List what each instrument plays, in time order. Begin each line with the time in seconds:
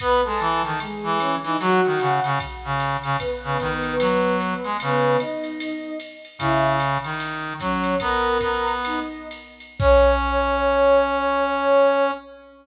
0.00 brass section B3, ocarina B4 B5, kick, ride
0.24 brass section G#3, ocarina A4 A5
0.40 brass section E3, hi-hat pedal, ride
0.64 brass section D#3, ocarina A4 A5, ride
0.80 ocarina G#3 G#4, ride
1.03 brass section E3
1.19 ocarina C#4 C#5, hi-hat pedal, ride
1.43 brass section E3, ocarina D#4 D#5, ride
1.60 brass section F#3, ocarina F#4 F#5, ride
1.86 brass section D#3
2.00 brass section C#3, hi-hat pedal, ride
2.24 brass section C#3, ride
2.40 kick, ride
2.64 brass section C#3
2.80 hi-hat pedal, ride
3.03 brass section C#3, ride
3.19 ocarina B3 B4, kick, ride
3.44 brass section C#3
3.60 brass section D#3, kick, hi-hat pedal, ride
3.84 ride
3.99 brass section F#3, ride
4.40 hi-hat pedal, ride
4.64 brass section G#3, ride
4.80 brass section C#3, ocarina B3 B4, ride
5.20 ocarina D#4 D#5, hi-hat pedal, ride
5.44 ride
5.60 ride
6.00 hi-hat pedal, ride
6.25 ride
6.39 brass section C#3, ocarina E4 E5, kick, ride
6.80 hi-hat pedal, ride
7.04 brass section D#3, ride
7.20 ride
7.60 brass section F#3, ocarina C#4 C#5, kick, hi-hat pedal, ride
7.84 ride
8.00 brass section B3, ocarina A#4 A#5, kick, ride
8.41 brass section B3, kick, hi-hat pedal, ride
8.68 ride
8.85 ocarina D#4 D#5, ride
9.31 hi-hat pedal, ride
9.60 ride
9.79 brass section C#4, ocarina C#5, kick, crash